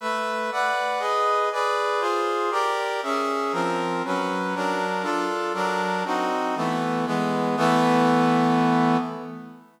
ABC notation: X:1
M:3/4
L:1/8
Q:1/4=119
K:Amix
V:1 name="Brass Section"
[A,Be]2 [Bdf]2 [^GB^d]2 | [^GBd]2 [=F_A=c]2 [=G_Bd]2 | [C^Ge]2 [=F,=C_B]2 [^F,^C=B]2 | [F,D^A]2 [D=F=A]2 [^F,D^A]2 |
[=C_E_G]2 [=E,A,B,]2 [E,^G,B,]2 | [E,A,B,]6 |]